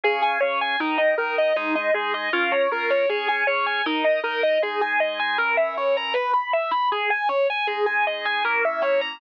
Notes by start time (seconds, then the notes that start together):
0.04 C#3 C#4 G#4
0.22 G#5
0.40 C#3 C#4 G#4 C#5
0.61 G#5
0.80 D#3 D#4 A#4
0.98 D#5
1.18 D#3 D#4 A#4
1.38 D#5
1.56 G#3 D#4 G#4
1.75 D#5
1.94 G#3 D#4 G#4
2.14 D#5
2.33 C#4 F4 A#4
2.52 C#5
2.71 C#4 F4 A#4
2.90 C#5
3.09 C#4 G#4 C#5
3.28 G#5
3.47 C#4 G#4 C#5
3.66 G#5
3.86 D#4 A#4 D#5
4.04 D#5
4.23 D#4 A#4 D#5
4.43 D#5
4.62 G#3 D#4 G#4
4.81 G#5
5.00 D#5
5.20 G#5
5.38 E3 C#4 A#4
5.57 E5
5.77 C#5
5.97 A#5
6.14 B4
6.34 B5
6.53 E5
6.71 B5
6.92 G#4
7.10 G#5
7.29 C#5
7.50 G#5
7.67 G#3 D#4 G#4
7.86 G#5
8.07 D#5
8.25 G#5
8.45 A#3 C#4 E4 A#4
8.65 E5
8.82 C#5
9.01 A#5